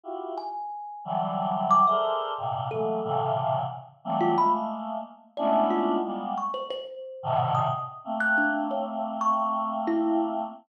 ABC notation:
X:1
M:4/4
L:1/16
Q:1/4=90
K:none
V:1 name="Choir Aahs"
[EF_G=G]2 z4 [D,E,_G,=G,]5 [_A=A_Bcde]3 [G,,_A,,_B,,C,]2 | [E,_G,_A,=A,_B,]2 [A,,_B,,C,_D,=D,E,]4 z2 [E,G,=G,A,B,C]2 [_A,=A,B,]4 z2 | [_A,=A,B,_D=DE]4 [G,_A,_B,=B,]2 z5 [_A,,=A,,B,,C,D,_E,]3 z2 | [A,_B,C]16 |]
V:2 name="Kalimba"
z2 _a6 z2 d' e z4 | A4 z5 F b z5 | d z F2 z2 _d' c c4 z _e'2 z | z _g' D2 _d z2 _d'3 z E2 z3 |]